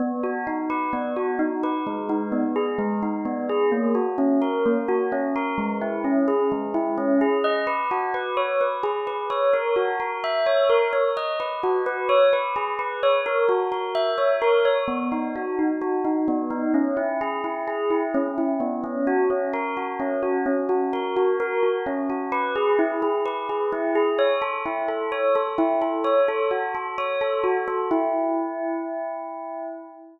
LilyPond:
\new Staff { \time 4/4 \key b \major \tempo 4 = 129 b8 fis'8 dis'8 b'8 b8 fis'8 dis'8 b'8 | gis8 dis'8 b8 gis'8 gis8 dis'8 b8 gis'8 | ais8 fis'8 cis'8 ais'8 ais8 fis'8 cis'8 ais'8 | gis8 e'8 cis'8 gis'8 gis8 e'8 cis'8 gis'8 |
dis''8 b'8 fis'8 b'8 cis''8 b'8 gis'8 b'8 | cis''8 ais'8 fis'8 ais'8 e''8 cis''8 ais'8 cis''8 | dis''8 b'8 fis'8 b'8 cis''8 b'8 gis'8 b'8 | cis''8 ais'8 fis'8 ais'8 e''8 cis''8 ais'8 cis''8 |
b8 dis'8 fis'8 dis'8 fis'8 dis'8 b8 dis'8 | cis'8 e'8 gis'8 e'8 gis'8 e'8 cis'8 e'8 | b8 cis'8 fis'8 cis'8 ais'8 fis'8 cis'8 fis'8 | cis'8 fis'8 ais'8 fis'8 ais'8 fis'8 cis'8 fis'8 |
\key e \major b'8 gis'8 e'8 gis'8 b'8 gis'8 e'8 gis'8 | cis''8 a'8 e'8 a'8 cis''8 a'8 e'8 a'8 | cis''8 a'8 fis'8 a'8 cis''8 a'8 fis'8 a'8 | e'1 | }